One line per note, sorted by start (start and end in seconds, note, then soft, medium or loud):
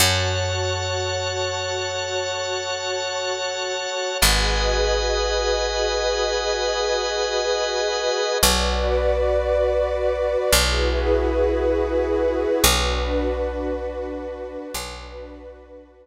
0.00 3.87 F#2 medium
0.00 4.17 F#4 medium
0.00 4.17 A4 medium
0.00 4.17 C#5 medium
0.00 4.18 C#5 medium
0.00 4.18 F#5 medium
0.00 4.18 A5 medium
4.21 8.10 G#1 medium
4.21 8.39 F#4 medium
4.21 8.39 G#4 medium
4.21 8.38 B4 medium
4.21 8.39 B4 medium
4.21 8.38 D#5 medium
4.21 8.39 D#5 medium
4.21 8.38 F#5 medium
4.21 8.38 G#5 medium
8.43 10.36 B1 loud
8.43 10.52 F#4 loud
8.43 10.52 B4 medium
8.43 10.52 D5 medium
10.52 12.46 B1 medium
10.52 12.63 E4 medium
10.52 12.62 F#4 medium
10.52 12.63 G#4 medium
10.52 12.62 B4 medium
12.62 14.57 B1 loud
12.62 14.71 D4 medium
12.62 14.71 F#4 loud
12.62 14.71 B4 medium
14.74 16.07 B1 loud
14.74 16.07 D4 medium
14.74 16.07 F#4 medium
14.74 16.07 B4 loud